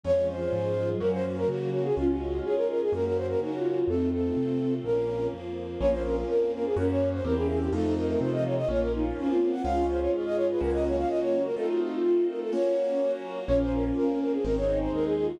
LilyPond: <<
  \new Staff \with { instrumentName = "Flute" } { \time 4/4 \key bes \minor \tempo 4 = 125 des''8 c''4. bes'16 c''16 r16 bes'16 ges'8 ges'16 aes'16 | f'16 ges'8. aes'16 bes'16 bes'16 aes'16 bes'16 bes'16 c''16 bes'16 ges'4 | a'8 a'4. bes'4 r4 | des''16 c''16 bes'16 r16 bes'8 bes'16 aes'16 bes'16 des''8 c''16 bes'16 aes'16 aes'16 g'16 |
a'8 bes'16 bes'16 c''16 ees''16 des''16 ees''16 des''16 bes'16 ees'16 r8 f'8 ges''16 | f''8 c''16 des''16 r16 ees''16 des''16 ces''16 bes'16 ees''16 des''16 f''16 ees''16 des''8 bes'16 | a'16 ges'16 f'16 r16 f'8 bes'16 a'16 des''4. r8 | des''16 c''16 bes'16 r16 bes'8 bes'16 aes'16 bes'16 des''8 c''16 bes'16 aes'16 aes'16 ges'16 | }
  \new Staff \with { instrumentName = "Ocarina" } { \time 4/4 \key bes \minor f4. f16 ges16 ges4. r8 | des'8 r8 des''8 r8 ges'4 ees'16 f'16 f'8 | c'2 r2 | bes8 r8 bes'8 r8 des'4 c'16 des'16 des'8 |
ees'8 r8 f8 r8 bes4 des'16 c'16 c'8 | f'1 | f'4. f'4 r4. | des'2 r8 ees'4 f'8 | }
  \new Staff \with { instrumentName = "Acoustic Grand Piano" } { \time 4/4 \key bes \minor <aes des' f'>2 <bes des' ges'>2 | <aes des' f'>2 <bes des' ges'>2 | r1 | <bes des' f'>2 <bes des' ges'>4 <bes c' e' g'>4 |
<a c' ees' f'>2 <bes des' f'>2 | <aes des' f'>2 <bes des' ges'>2 | <a c' ees' f'>2 <bes des' ges'>2 | <bes des' f'>2 <aes c' ees'>2 | }
  \new Staff \with { instrumentName = "Acoustic Grand Piano" } { \clef bass \time 4/4 \key bes \minor f,4 aes,4 ges,4 des4 | des,4 aes,4 ges,4 des4 | f,4 c4 bes,,4 f,4 | bes,,4 f,4 ges,4 e,4 |
f,4 c4 bes,,4 f,4 | des,4 aes,4 des,4 des,4 | r1 | bes,,4 f,4 aes,,4 ees,4 | }
  \new Staff \with { instrumentName = "String Ensemble 1" } { \time 4/4 \key bes \minor <aes des' f'>4 <aes f' aes'>4 <bes des' ges'>4 <ges bes ges'>4 | <aes des' f'>4 <aes f' aes'>4 <bes des' ges'>4 <ges bes ges'>4 | <a c' ees' f'>4 <a c' f' a'>4 <bes des' f'>4 <f bes f'>4 | <bes des' f'>4 <f bes f'>4 <bes des' ges'>4 <bes c' e' g'>4 |
<a c' ees' f'>4 <a c' f' a'>4 <bes des' f'>4 <f bes f'>4 | <aes des' f'>4 <aes f' aes'>4 <bes des' ges'>4 <ges bes ges'>4 | <a c' ees' f'>4 <a c' f' a'>4 <bes des' ges'>4 <ges bes ges'>4 | <bes des' f'>4 <f bes f'>4 <aes c' ees'>4 <aes ees' aes'>4 | }
>>